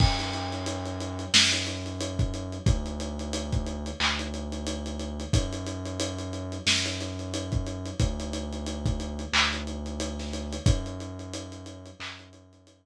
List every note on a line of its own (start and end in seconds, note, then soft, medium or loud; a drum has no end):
0.00 1.25 F#2 loud
0.00 kick medium
0.00 crash medium
0.19 snare soft
0.19 closed hi-hat medium
0.33 closed hi-hat medium
0.52 closed hi-hat medium
0.66 closed hi-hat medium
0.86 closed hi-hat medium
1.00 closed hi-hat medium
1.19 closed hi-hat medium
1.34 2.58 F#2 loud
1.34 snare loud
1.52 closed hi-hat medium
1.67 closed hi-hat medium
1.86 closed hi-hat medium
2.01 closed hi-hat medium
2.19 kick medium
2.19 closed hi-hat medium
2.34 closed hi-hat medium
2.52 closed hi-hat medium
2.66 3.90 D2 loud
2.66 kick medium
2.66 closed hi-hat medium
2.86 closed hi-hat medium
3.00 closed hi-hat medium
3.19 closed hi-hat medium
3.33 closed hi-hat medium
3.53 kick medium
3.53 closed hi-hat medium
3.66 closed hi-hat medium
3.86 closed hi-hat medium
4.00 5.24 D2 loud
4.00 clap medium
4.19 closed hi-hat medium
4.34 closed hi-hat medium
4.52 closed hi-hat medium
4.67 closed hi-hat medium
4.86 closed hi-hat medium
4.99 closed hi-hat medium
5.20 closed hi-hat medium
5.33 6.58 F#2 loud
5.33 kick medium
5.33 closed hi-hat medium
5.53 closed hi-hat medium
5.67 closed hi-hat medium
5.85 closed hi-hat medium
6.00 closed hi-hat medium
6.18 closed hi-hat medium
6.33 closed hi-hat medium
6.52 closed hi-hat medium
6.66 7.91 F#2 loud
6.66 snare medium
6.86 closed hi-hat medium
7.01 closed hi-hat medium
7.19 closed hi-hat medium
7.34 closed hi-hat medium
7.52 kick medium
7.52 closed hi-hat medium
7.67 closed hi-hat medium
7.86 closed hi-hat medium
8.00 9.24 D2 loud
8.00 kick medium
8.00 closed hi-hat medium
8.20 closed hi-hat medium
8.33 closed hi-hat medium
8.53 closed hi-hat medium
8.66 closed hi-hat medium
8.86 kick medium
8.86 closed hi-hat medium
9.00 closed hi-hat medium
9.19 closed hi-hat medium
9.33 10.57 D2 loud
9.33 clap loud
9.53 closed hi-hat medium
9.67 closed hi-hat medium
9.86 closed hi-hat medium
10.00 closed hi-hat medium
10.19 snare soft
10.19 closed hi-hat medium
10.33 closed hi-hat medium
10.53 closed hi-hat medium
10.66 11.90 F#2 loud
10.66 kick medium
10.66 closed hi-hat medium
10.86 closed hi-hat medium
11.00 closed hi-hat medium
11.19 closed hi-hat medium
11.33 closed hi-hat medium
11.52 closed hi-hat medium
11.66 closed hi-hat medium
11.86 closed hi-hat medium
12.00 12.86 F#2 loud
12.00 clap medium
12.19 closed hi-hat medium
12.33 closed hi-hat medium
12.53 closed hi-hat medium
12.67 closed hi-hat medium